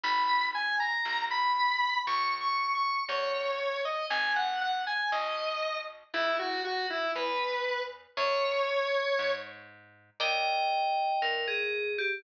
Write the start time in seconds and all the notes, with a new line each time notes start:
0.03 G#1 B5
0.54 G#5
0.80 A#5
1.05 B1
1.31 B5
2.07 C#2 C#6
2.41 C#6
2.75 C#6
3.09 E2 C#5
3.85 D#5
4.10 G#1 G#5
4.36 F#5
4.61 F#5
4.87 G#5
5.12 B1 D#5
6.14 C#2 E4
6.39 F#4
6.64 F#4
6.90 E4
7.15 E2 B4
8.17 F#2 C#5
9.19 G#2
10.20 D#2 A#4 D5 D#5 G5
11.22 G2 A#4
11.48 G#4
11.98 G4